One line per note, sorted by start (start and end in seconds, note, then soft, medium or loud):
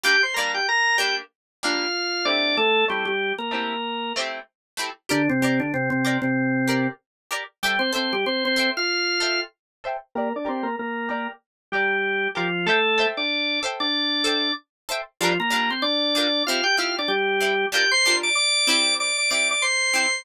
0.03 0.16 G3 medium
0.03 0.16 A#3 medium
0.03 0.16 D4 medium
0.03 0.22 G4 medium
0.03 0.22 G5 medium
0.23 0.35 C5 soft
0.23 0.35 C6 medium
0.34 0.60 G3 medium
0.34 0.60 A#3 medium
0.34 0.52 A#4 medium
0.34 0.52 A#5 medium
0.39 0.60 D4 medium
0.54 0.67 G4 medium
0.54 0.67 G5 medium
0.69 0.97 A#4 medium
0.69 0.97 A#5 medium
0.98 1.22 G3 medium
0.98 1.22 A#3 medium
0.98 1.22 D4 medium
0.98 1.15 G4 medium
0.98 1.15 G5 medium
1.63 1.87 G3 medium
1.63 1.87 A#3 medium
1.63 1.87 D4 medium
1.63 2.26 F4 medium
1.63 2.26 F5 medium
2.25 2.70 A3 medium
2.25 2.70 C4 loud
2.25 2.56 D4 medium
2.25 2.70 E4 loud
2.25 2.70 G4 loud
2.25 2.56 D5 medium
2.57 2.85 A3 medium
2.57 2.85 A4 medium
2.88 3.05 G3 medium
2.88 3.12 A3 medium
2.88 3.12 C4 medium
2.88 3.12 E4 medium
2.88 3.05 G4 medium
2.88 3.12 G4 medium
3.05 3.33 G3 medium
3.05 3.33 G4 medium
3.38 4.13 A#3 medium
3.38 4.13 A#4 medium
3.51 3.75 A3 medium
3.51 3.75 C4 medium
3.51 3.75 E4 medium
3.51 3.75 G4 medium
4.16 4.40 A3 medium
4.16 4.40 C4 medium
4.16 4.40 E4 medium
4.16 4.40 G4 medium
4.77 4.90 A3 medium
4.77 4.90 C4 medium
4.77 4.90 E4 medium
4.77 4.90 G4 medium
5.09 5.28 D3 medium
5.09 5.28 D4 medium
5.09 5.22 G4 loud
5.09 5.22 A#4 loud
5.09 5.22 D5 loud
5.29 5.41 C3 medium
5.29 5.41 C4 medium
5.42 5.59 C3 medium
5.42 5.59 C4 medium
5.42 5.66 G4 medium
5.42 5.66 A#4 medium
5.42 5.66 D5 medium
5.60 5.72 D3 medium
5.60 5.72 D4 medium
5.74 5.90 C3 medium
5.74 5.90 C4 medium
5.90 6.18 C3 medium
5.90 6.18 C4 medium
6.05 6.28 G4 medium
6.05 6.28 A#4 medium
6.05 6.28 D5 medium
6.22 6.87 C3 medium
6.22 6.87 C4 medium
6.68 6.91 G4 medium
6.68 6.91 A#4 medium
6.68 6.91 D5 medium
7.31 7.44 G4 medium
7.31 7.44 A#4 loud
7.31 7.44 D5 medium
7.63 7.80 G3 medium
7.63 7.80 G4 medium
7.63 7.76 A4 loud
7.63 7.76 C5 loud
7.63 7.76 E5 medium
7.63 7.76 G5 medium
7.79 7.91 C4 medium
7.79 7.91 C5 medium
7.93 8.13 C4 medium
7.93 8.16 A4 medium
7.93 8.16 C5 medium
7.93 8.13 C5 medium
7.93 8.16 E5 medium
7.93 8.16 G5 medium
8.13 8.25 G3 medium
8.13 8.25 G4 medium
8.26 8.44 C4 medium
8.26 8.44 C5 medium
8.45 8.70 C4 medium
8.45 8.70 C5 medium
8.56 8.80 A4 medium
8.56 8.80 C5 medium
8.56 8.80 E5 medium
8.56 8.80 G5 medium
8.77 9.40 F4 medium
8.77 9.40 F5 medium
9.20 9.44 A4 medium
9.20 9.44 C5 medium
9.20 9.44 E5 medium
9.20 9.44 G5 medium
9.84 9.97 A4 medium
9.84 9.97 C5 loud
9.84 9.97 E5 medium
9.84 9.97 G5 medium
10.15 10.33 A#3 medium
10.15 10.29 G4 loud
10.15 10.33 A#4 medium
10.15 10.29 A#4 loud
10.15 10.29 D5 loud
10.36 10.48 D4 medium
10.36 10.48 D5 medium
10.45 10.66 C4 medium
10.45 10.68 G4 medium
10.45 10.68 A#4 loud
10.45 10.66 C5 medium
10.45 10.68 D5 medium
10.63 10.76 A#3 medium
10.63 10.76 A#4 medium
10.79 11.09 A#3 medium
10.79 11.09 A#4 medium
11.09 11.27 A#3 medium
11.09 11.32 G4 medium
11.09 11.32 A#4 medium
11.09 11.27 A#4 medium
11.09 11.32 D5 medium
11.72 12.28 G3 medium
11.72 12.28 G4 medium
11.72 11.97 G4 medium
11.72 11.97 A#4 medium
11.72 11.97 D5 medium
12.35 12.66 F3 medium
12.35 12.66 F4 medium
12.35 12.48 G4 medium
12.35 12.48 A#4 medium
12.35 12.48 D5 medium
12.66 13.06 A3 medium
12.66 13.06 A4 medium
12.66 12.79 A4 loud
12.66 12.79 C5 loud
12.66 12.79 E5 loud
12.66 12.79 G5 loud
12.98 13.21 A4 medium
12.98 13.21 C5 medium
12.98 13.21 E5 medium
12.98 13.21 G5 medium
13.17 13.60 D4 medium
13.17 13.60 D5 medium
13.63 13.86 A4 medium
13.63 13.86 C5 medium
13.63 13.86 E5 medium
13.63 13.86 G5 medium
13.80 14.52 D4 medium
13.80 14.52 D5 medium
14.24 14.48 A4 medium
14.24 14.48 C5 medium
14.24 14.48 E5 medium
14.24 14.48 G5 medium
14.89 15.02 A4 medium
14.89 15.02 C5 medium
14.89 15.02 E5 medium
14.89 15.02 G5 loud
15.21 15.38 F3 medium
15.21 15.33 G3 loud
15.21 15.33 D4 medium
15.21 15.38 F4 medium
15.21 15.33 F4 medium
15.21 15.33 A#4 loud
15.40 15.70 A#3 medium
15.40 15.70 A#4 medium
15.50 15.74 G3 medium
15.50 15.74 D4 medium
15.50 15.74 F4 medium
15.50 15.74 A#4 medium
15.70 15.83 C4 medium
15.70 15.83 C5 medium
15.82 16.43 D4 medium
15.82 16.43 D5 medium
16.15 16.28 G3 medium
16.15 16.28 D4 medium
16.15 16.28 F4 medium
16.15 16.28 A#4 medium
16.47 16.61 C4 medium
16.47 16.61 E4 medium
16.47 16.64 F4 medium
16.47 16.61 G4 medium
16.47 16.64 F5 medium
16.64 16.76 G4 medium
16.64 16.76 G5 medium
16.77 17.01 C4 medium
16.77 17.01 E4 medium
16.77 16.96 F4 medium
16.77 17.01 G4 medium
16.77 16.96 F5 medium
16.99 17.11 D4 medium
16.99 17.11 D5 medium
17.08 17.66 G3 medium
17.08 17.66 G4 medium
17.40 17.53 C4 medium
17.40 17.53 E4 medium
17.40 17.53 G4 medium
17.72 17.85 G3 medium
17.72 17.85 D4 medium
17.72 17.85 F4 medium
17.72 17.91 G4 medium
17.72 17.85 A#4 medium
17.72 17.91 G5 medium
17.91 18.16 C5 medium
17.91 18.16 C6 medium
18.05 18.29 G3 medium
18.05 18.29 D4 medium
18.05 18.29 F4 medium
18.05 18.29 A#4 medium
18.23 18.35 D5 medium
18.23 18.35 D6 medium
18.35 18.94 D5 medium
18.35 18.94 D6 medium
18.67 19.12 C4 medium
18.67 19.12 E4 loud
18.67 19.12 G4 medium
19.00 19.17 D5 medium
19.00 19.17 D6 medium
19.18 19.30 D5 medium
19.18 19.30 D6 medium
19.31 19.54 C4 medium
19.31 19.54 E4 medium
19.31 19.54 G4 medium
19.31 19.48 D5 medium
19.31 19.48 D6 medium
19.51 19.63 D5 medium
19.51 19.63 D6 medium
19.62 20.22 C5 medium
19.62 20.22 C6 medium
19.94 20.06 C4 medium
19.94 20.06 E4 medium
19.94 20.06 G4 medium